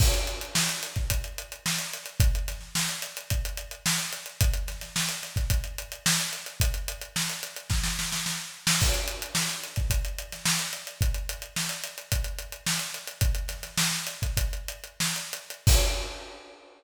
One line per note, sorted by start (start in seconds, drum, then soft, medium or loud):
0.00 kick loud
0.00 crash loud
0.14 closed hi-hat medium
0.27 closed hi-hat medium
0.41 closed hi-hat medium
0.55 snare loud
0.69 closed hi-hat medium
0.83 closed hi-hat medium
0.96 kick medium
0.96 closed hi-hat medium
1.10 kick medium
1.10 closed hi-hat medium
1.24 closed hi-hat medium
1.38 closed hi-hat medium
1.52 closed hi-hat medium
1.66 snare medium
1.79 closed hi-hat medium
1.93 closed hi-hat medium
2.06 closed hi-hat medium
2.20 kick loud
2.20 closed hi-hat medium
2.35 closed hi-hat medium
2.48 snare soft
2.48 closed hi-hat medium
2.61 snare soft
2.75 snare medium
2.89 closed hi-hat medium
3.02 closed hi-hat medium
3.17 closed hi-hat medium
3.30 kick medium
3.30 closed hi-hat medium
3.45 closed hi-hat medium
3.57 closed hi-hat medium
3.71 closed hi-hat medium
3.86 snare loud
3.98 closed hi-hat medium
4.13 closed hi-hat medium
4.26 closed hi-hat medium
4.41 kick medium
4.41 closed hi-hat loud
4.54 closed hi-hat medium
4.68 snare soft
4.68 closed hi-hat medium
4.81 snare soft
4.81 closed hi-hat medium
4.96 snare medium
5.09 closed hi-hat medium
5.23 snare soft
5.23 closed hi-hat medium
5.36 kick medium
5.36 closed hi-hat medium
5.50 kick medium
5.50 closed hi-hat medium
5.64 closed hi-hat medium
5.78 closed hi-hat medium
5.92 closed hi-hat medium
6.06 snare loud
6.20 closed hi-hat medium
6.33 closed hi-hat medium
6.46 closed hi-hat medium
6.60 kick medium
6.60 closed hi-hat loud
6.74 closed hi-hat medium
6.88 closed hi-hat medium
7.01 closed hi-hat medium
7.16 snare medium
7.30 closed hi-hat medium
7.43 closed hi-hat medium
7.56 closed hi-hat medium
7.70 kick medium
7.70 snare medium
7.83 snare medium
7.99 snare medium
8.12 snare medium
8.26 snare medium
8.67 snare loud
8.81 kick medium
8.81 crash medium
8.94 closed hi-hat medium
9.08 closed hi-hat medium
9.22 closed hi-hat medium
9.35 snare medium
9.50 closed hi-hat medium
9.64 closed hi-hat medium
9.76 kick medium
9.76 closed hi-hat medium
9.90 kick medium
9.90 closed hi-hat medium
10.05 closed hi-hat medium
10.18 closed hi-hat medium
10.32 snare soft
10.32 closed hi-hat medium
10.46 snare loud
10.59 closed hi-hat medium
10.73 closed hi-hat medium
10.87 closed hi-hat medium
11.01 kick medium
11.01 closed hi-hat medium
11.14 closed hi-hat medium
11.29 closed hi-hat medium
11.42 closed hi-hat medium
11.56 snare medium
11.69 closed hi-hat medium
11.84 closed hi-hat medium
11.98 closed hi-hat medium
12.12 kick medium
12.12 closed hi-hat medium
12.24 closed hi-hat medium
12.39 closed hi-hat medium
12.52 closed hi-hat medium
12.67 snare medium
12.79 snare soft
12.79 closed hi-hat medium
12.94 closed hi-hat medium
13.07 closed hi-hat medium
13.21 kick medium
13.21 closed hi-hat medium
13.35 closed hi-hat medium
13.48 snare soft
13.48 closed hi-hat medium
13.63 snare soft
13.63 closed hi-hat medium
13.77 snare loud
13.91 snare soft
14.07 closed hi-hat medium
14.22 kick medium
14.22 closed hi-hat medium
14.37 kick medium
14.37 closed hi-hat medium
14.53 closed hi-hat medium
14.68 closed hi-hat medium
14.84 closed hi-hat medium
15.00 snare medium
15.16 closed hi-hat medium
15.33 closed hi-hat medium
15.50 closed hi-hat medium
15.67 kick loud
15.67 crash loud